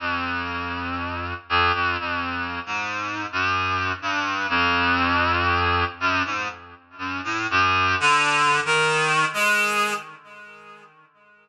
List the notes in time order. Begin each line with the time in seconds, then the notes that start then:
0.00 F2
1.49 F2
1.74 F2
2.00 F2
2.66 G#2
3.32 F#2
4.02 G2
4.49 F2
6.00 F#2
6.25 G#2
6.98 F#2
7.24 A2
7.50 F#2
8.00 D3
8.65 D#3
9.34 G#3